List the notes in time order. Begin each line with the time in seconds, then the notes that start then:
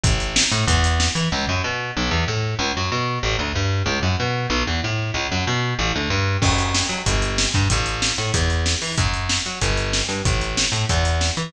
0.03 A1, kick, closed hi-hat
0.20 closed hi-hat
0.36 snare
0.52 A2, closed hi-hat
0.67 E2, kick, closed hi-hat
0.84 closed hi-hat
1.00 snare
1.15 E3, closed hi-hat
1.32 C#2
1.49 F#2
1.64 B2
1.97 B1
2.11 E2
2.28 A2
2.59 C#2
2.77 F#2
2.92 B2
3.23 A1
3.39 D2
3.55 G2
3.86 C#2
4.03 F#2
4.20 B2
4.50 B1
4.67 E2
4.84 A2
5.14 C#2
5.32 F#2
5.47 B2
5.79 A1
5.95 D2
6.10 G2
6.42 F#2, kick, crash
6.58 closed hi-hat
6.74 snare
6.89 F#3, closed hi-hat
7.06 G1, kick, closed hi-hat
7.22 closed hi-hat
7.38 snare
7.54 G2, kick, closed hi-hat
7.70 A1, kick, closed hi-hat
7.86 closed hi-hat
8.02 snare
8.18 A2, closed hi-hat
8.34 E2, kick, closed hi-hat
8.50 closed hi-hat
8.66 snare
8.82 E3, open hi-hat
8.97 F#2, kick, closed hi-hat
9.14 closed hi-hat
9.29 snare
9.46 F#3, closed hi-hat
9.61 G1, kick, closed hi-hat
9.77 closed hi-hat
9.93 snare
10.08 G2, closed hi-hat
10.25 A1, kick, closed hi-hat
10.41 closed hi-hat
10.57 snare
10.72 A2, closed hi-hat
10.89 E2, kick, closed hi-hat
11.05 closed hi-hat
11.21 snare
11.37 E3, closed hi-hat